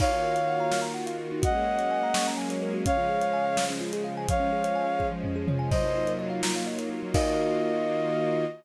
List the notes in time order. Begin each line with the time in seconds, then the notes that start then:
0.00 D#3 A#3 D#4 F4 F#4 C#5 F5, kick, crash
0.11 F#4
0.23 A#4
0.35 F5, closed hi-hat
0.48 F#5
0.60 A#5
0.71 F6, snare
0.82 A#5
0.94 F#5
1.06 F5, closed hi-hat
1.19 A#4
1.32 D#4
1.42 F#3 G#3 A#3 C#4 F#4 D#5 F#5, kick, closed hi-hat
1.56 G#4
1.67 A#4
1.79 C#5, closed hi-hat
1.91 G#5
2.03 A#5
2.14 C#6, snare
2.27 A#5
2.37 G#5
2.50 C#5, closed hi-hat
2.63 A#4
2.74 F#4
2.86 C#3 F3 G#3 C#4 C#5 F5, kick, closed hi-hat
2.97 F4
3.09 G#4
3.21 F5, closed hi-hat
3.33 G#5
3.45 F5
3.57 G#4, snare
3.70 C#4
3.81 F4
3.93 G#4, closed hi-hat
4.04 F5
4.17 G#5
4.28 F3 G#3 C#4 C#5 F5, kick, closed hi-hat
4.40 C#4
4.52 G#4
4.64 C#5, closed hi-hat
4.75 G#5
4.88 C#5
4.99 G#4, kick
5.12 F3
5.24 C#4, floor tom
5.36 G#4
5.48 C#5, mid tom
5.59 G#5
5.71 F#3 A#3 D#4 F4 C5 D#5, kick, crash
5.84 D#4
5.95 F4
6.07 A#4, closed hi-hat
6.19 D#5
6.30 F5
6.43 A#5, snare
6.56 F5
6.66 D#5
6.78 A#4, closed hi-hat
6.90 F4
7.03 F#3
7.14 D#3 A#3 D#4 F4 F#4 A#4 D#5 F5, kick, crash